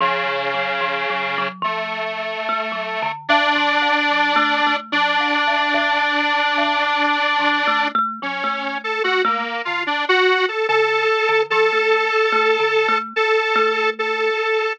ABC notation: X:1
M:6/4
L:1/16
Q:1/4=73
K:none
V:1 name="Kalimba"
(3F,2 F,2 _G,2 (3F,2 G,2 G,2 F,4 (3A,2 G,2 D,2 (3A,,2 F,2 _B,,2 (3G,2 A,2 A,2 | (3_G,2 _B,,2 A,,2 A,,4 A,,2 z2 (3F,2 A,2 A,2 G, A,3 A, A, z D, | z4 _D,2 z =D, F, A,2 z (3A,2 D,2 A,2 z2 A,4 z2 |]
V:2 name="Lead 1 (square)"
_D,8 A,8 =D8 | D16 _D3 A _G _B,2 F | D _G2 A A4 A8 A4 A4 |]